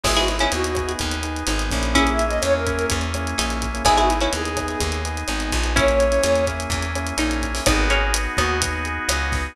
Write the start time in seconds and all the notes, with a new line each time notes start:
0.03 G#1 B3 D#4 E4 G#4, kick, cross-stick, crash
0.16 E4 F#4 G#4, closed hi-hat
0.28 E4, closed hi-hat
0.39 B3 C#4 D#4 E4 G#4, closed hi-hat
0.52 D#2 B3 D#4 F#4 G#4, closed hi-hat
0.64 closed hi-hat
0.75 B3 D#4 G#4, kick, cross-stick, closed hi-hat
0.89 closed hi-hat
0.99 D#2, kick, closed hi-hat
1.12 closed hi-hat
1.23 B3 D#4 G#4, closed hi-hat
1.36 closed hi-hat
1.47 G#1 B3 D#4 G#4, cross-stick, closed hi-hat
1.59 closed hi-hat
1.70 A#1 A#3 C#4 E4 G#4, kick, closed hi-hat
1.83 closed hi-hat
1.94 A#3 C#4 E4 G#4, kick, closed hi-hat
2.07 closed hi-hat
2.11 E5
2.19 closed hi-hat
2.27 D#5, closed hi-hat
2.31 A#3 C#4 E4 G#4
2.42 E2 A#3 C#4 E4 G#4 C#5, cross-stick, closed hi-hat
2.54 A#4
2.66 A#3 C#4 E4 G#4 A#4, kick, closed hi-hat
2.79 closed hi-hat
2.90 E2, kick, closed hi-hat
3.01 closed hi-hat
3.14 A#3 C#4 E4 G#4, cross-stick, closed hi-hat
3.27 closed hi-hat
3.38 A#1 A#3 C#4 D#4 E4 G#4, closed hi-hat
3.50 closed hi-hat
3.62 kick, closed hi-hat
3.74 A#3 C#4 E4 G#4, closed hi-hat
3.85 G#1 B3 D#4 E4 G#4, kick, cross-stick, closed hi-hat
3.97 E4 F#4 G#4, closed hi-hat
4.09 E4, closed hi-hat
4.21 B3 C#4 D#4 E4 G#4, closed hi-hat
4.33 D#2 B3 D#4 G#4, closed hi-hat
4.45 closed hi-hat
4.57 B3 D#4 G#4, kick, cross-stick, closed hi-hat
4.68 closed hi-hat
4.80 D#2, kick, closed hi-hat
4.92 closed hi-hat
5.04 B3 D#4 G#4, closed hi-hat
5.17 closed hi-hat
5.28 G#1 B3 D#4 G#4, cross-stick, closed hi-hat
5.40 closed hi-hat
5.52 A#1, kick, closed hi-hat
5.63 B3 D#4 G#4, closed hi-hat
5.76 A#3 C#4 E4 G#4 C#5, kick, closed hi-hat
5.88 closed hi-hat
6.00 closed hi-hat
6.12 A#3 C#4 E4 G#4, closed hi-hat
6.23 E2 A#3 C#4 E4 G#4, cross-stick, closed hi-hat
6.36 closed hi-hat
6.47 A#3 C#4 E4 G#4, kick, closed hi-hat
6.60 closed hi-hat
6.70 E2, kick, closed hi-hat
6.82 closed hi-hat
6.95 A#3 C#4 E4 G#4, cross-stick, closed hi-hat
7.07 closed hi-hat
7.18 A#1 A#3 C#4 D#4 E4 G#4, closed hi-hat
7.31 closed hi-hat
7.42 kick, closed hi-hat
7.54 A#3 C#4 E4 G#4, open hi-hat
7.66 G#1 B3 D#4 F#4 G#4, kick, cross-stick, closed hi-hat
7.90 A#3 C#4 G#4, closed hi-hat
8.14 B3, closed hi-hat
8.37 D#2 B3 D#4 F#4, kick, cross-stick, closed hi-hat
8.62 B3, kick, closed hi-hat
8.85 G#4, closed hi-hat
9.09 C#2 D#4 F#4, cross-stick, closed hi-hat
9.32 B3, kick, snare, closed hi-hat